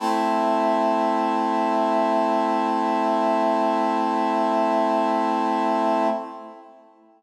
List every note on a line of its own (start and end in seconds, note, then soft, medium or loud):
0.00 6.08 A3 medium
0.00 6.08 C4 medium
0.00 6.08 E4 medium